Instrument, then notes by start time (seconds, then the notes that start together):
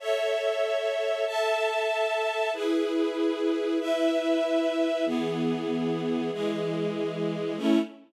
string ensemble 1
0.00 A4 C#5 E5
1.26 A4 E5 A5
2.53 E4 G#4 B4
3.80 E4 B4 E5
5.06 E3 B3 G#4
6.32 E3 G#3 G#4
7.57 A3 C#4 E4